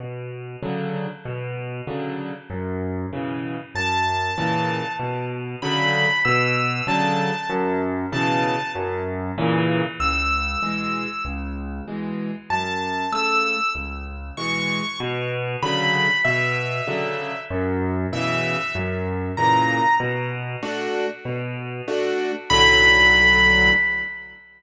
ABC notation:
X:1
M:6/8
L:1/8
Q:3/8=96
K:Bm
V:1 name="Acoustic Grand Piano"
z6 | z6 | z6 | a6 |
z3 b3 | e'3 a3 | z3 a3 | z6 |
[K:C#m] e'6 | z6 | a3 e'3 | z3 c'3 |
[K:Bm] z3 b3 | e6 | z3 e3 | z3 ^a3 |
z6 | z6 | b6 |]
V:2 name="Acoustic Grand Piano"
B,,3 [C,D,F,]3 | B,,3 [C,D,F,]3 | F,,3 [B,,C,E,]3 | F,,3 [^A,,C,E,]3 |
B,,3 [C,D,F,]3 | B,,3 [C,D,F,]3 | F,,3 [B,,C,E,]3 | F,,3 [^A,,C,E,]3 |
[K:C#m] C,,3 [B,,E,G,]3 | C,,3 [B,,E,G,]3 | F,,3 [C,A,]3 | C,,3 [B,,E,G,]3 |
[K:Bm] B,,3 [C,D,F,]3 | B,,3 [C,D,F,]3 | F,,3 [B,,C,E,]3 | F,,3 [^A,,C,E,]3 |
B,,3 [A,DF]3 | B,,3 [A,DF]3 | [B,,,A,,D,F,]6 |]